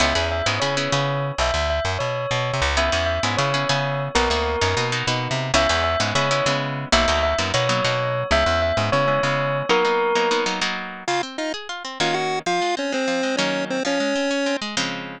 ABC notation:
X:1
M:9/8
L:1/16
Q:3/8=130
K:C#m
V:1 name="Tubular Bells"
e4 e2 z2 c10 | e4 e2 z2 c10 | e4 e2 z2 c10 | ^A10 z8 |
e4 e2 z2 c5 z5 | e4 e2 z2 c10 | e4 e2 z2 c10 | ^A10 z8 |
[K:Db] z18 | z18 | z18 |]
V:2 name="Lead 1 (square)"
z18 | z18 | z18 | z18 |
z18 | z18 | z18 | z18 |
[K:Db] [Ff]2 z2 [Ee]2 z6 [Ff]2 [Gg]4 | [Ff]4 [Dd]2 [Cc]6 [Dd]4 [Cc]2 | [Dd]10 z8 |]
V:3 name="Acoustic Guitar (steel)"
[B,CEG]2 [B,CEG]4 [B,CEG]2 [B,CEG]2 [B,CEG]2 [B,CEG]6 | z18 | [B,CEG]2 [B,CEG]4 [B,CEG]2 [B,CEG]2 [B,CEG]2 [B,CEG]6 | [^A,B,DF]2 [A,B,DF]4 [A,B,DF]2 [A,B,DF]2 [A,B,DF]2 [A,B,DF]6 |
[G,B,CE]2 [G,B,CE]4 [G,B,CE]2 [G,B,CE]2 [G,B,CE]2 [G,B,CE]6 | [F,^A,B,D]2 [F,A,B,D]4 [F,A,B,D]2 [F,A,B,D]2 [F,A,B,D]2 [F,A,B,D]6 | [G,B,CE]2 [G,B,CE]4 [G,B,CE]2 [G,B,CE]2 [G,B,CE]2 [G,B,CE]6 | [F,^A,B,D]2 [F,A,B,D]4 [F,A,B,D]2 [F,A,B,D]2 [F,A,B,D]2 [F,A,B,D]6 |
[K:Db] D,2 C2 F2 A2 F2 C2 [E,B,DG]6 | F,2 A,2 C2 A,2 F,2 A,2 [E,G,B,D]6 | F,2 A,2 C2 D2 C2 A,2 [D,F,A,C]6 |]
V:4 name="Electric Bass (finger)" clef=bass
C,,2 E,,4 G,,2 C,4 C,6 | B,,,2 =D,,4 F,,2 B,,4 B,,3 ^B,, C,,2- | C,,2 E,,4 G,,2 C,4 C,6 | B,,,2 =D,,4 F,,2 B,,4 B,,3 ^B,,3 |
C,,2 E,,4 G,,2 C,4 C,6 | B,,,2 =D,,4 F,,2 B,,4 B,,6 | C,,2 E,,4 G,,2 C,4 C,6 | z18 |
[K:Db] z18 | z18 | z18 |]